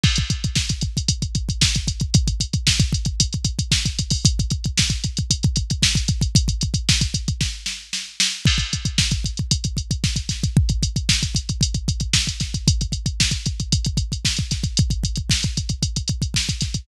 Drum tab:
CC |x---------------|----------------|----------------|----------------|
HH |-xxx-xxxxxxx-xxx|xxxx-xxxxxxx-xxo|xxxx-xxxxxxx-xxx|xxxx-xxx--------|
SD |----o-------o---|----o-------o---|----o-------o---|----o---o-o-o-o-|
BD |oooooooooooooooo|oooooooooooooooo|oooooooooooooooo|ooooooooo-------|

CC |x---------------|----------------|----------------|----------------|
HH |-xxx-xxxxxxx-xxx|-xxx-xxxxxxx-xxx|xxxx-xxxxxxx-xxx|xxxx-xxxxxxx-xxx|
SD |----o-------o-o-|----o-------o-o-|----o-------o-o-|----o-------o-o-|
BD |oooooooooooooooo|oooooooooooooooo|oooooooooooooooo|oooooooooooooooo|